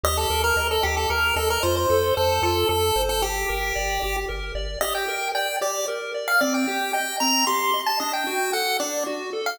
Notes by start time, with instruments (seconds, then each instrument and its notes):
0.04 synth bass 1 D#2, lead 1 (square) G4 D#5
0.17 lead 1 (square) A4
0.30 synth bass 1 D#2, lead 1 (square) A#4
0.44 lead 1 (square) A#4
0.56 synth bass 1 D#2, lead 1 (square) D#5
0.71 lead 1 (square) A4
0.83 synth bass 1 D#2, lead 1 (square) G4
0.97 lead 1 (square) A4
1.10 synth bass 1 D#2, lead 1 (square) A#4
1.36 synth bass 1 D#2, lead 1 (square) A4 D#5
1.50 lead 1 (square) A#4
1.63 synth bass 1 F2, lead 1 (square) F4 C5
1.77 lead 1 (square) C5
1.90 synth bass 1 F2, lead 1 (square) A4
2.16 synth bass 1 F2, lead 1 (square) A4 C5
2.42 synth bass 1 F2, lead 1 (square) F4 A4
2.69 synth bass 1 F2, lead 1 (square) A4
2.96 synth bass 1 G1, lead 1 (square) C5
3.09 lead 1 (square) A4
3.22 lead 1 (square) G4
3.49 synth bass 1 G1, lead 1 (square) A#4
3.75 synth bass 1 G1, lead 1 (square) D5
4.02 synth bass 1 G1, lead 1 (square) G4
4.29 synth bass 1 G1, lead 1 (square) A#4
4.55 synth bass 1 G1, lead 1 (square) D5
4.81 lead 1 (square) G4 D#5
4.95 lead 1 (square) G5
5.08 lead 1 (square) A#4
5.35 lead 1 (square) D5 G5
5.61 lead 1 (square) G4 D5
5.88 lead 1 (square) A#4
6.14 lead 1 (square) D5
6.28 lead 1 (square) F5
6.41 lead 1 (square) C4 D5
6.54 lead 1 (square) G5
6.67 lead 1 (square) G4
6.93 lead 1 (square) D#5 G5
7.20 lead 1 (square) C4 A#5
7.47 lead 1 (square) G4 C6
7.74 lead 1 (square) D#5
7.87 lead 1 (square) A5
8.00 lead 1 (square) D4 D#5
8.13 lead 1 (square) G5
8.27 lead 1 (square) F#4
8.53 lead 1 (square) A4 F#5
8.80 lead 1 (square) D4 D5
9.06 lead 1 (square) F#4
9.33 lead 1 (square) A4
9.46 lead 1 (square) F5